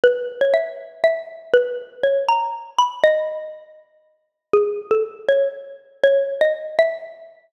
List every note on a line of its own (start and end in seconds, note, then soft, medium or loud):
0.04 0.35 B4 medium
0.41 0.53 C#5 medium
0.54 0.98 E5 medium
1.04 1.51 E5 medium
1.54 1.95 B4 medium
2.03 2.26 C#5 medium
2.29 2.70 A#5 medium
2.79 3.02 B5 medium
3.04 3.45 D#5 loud
4.53 4.89 G#4 medium
4.91 5.03 A4 medium
5.29 5.49 C#5 medium
6.04 6.34 C#5 medium
6.41 6.53 D#5 medium
6.79 7.02 E5 medium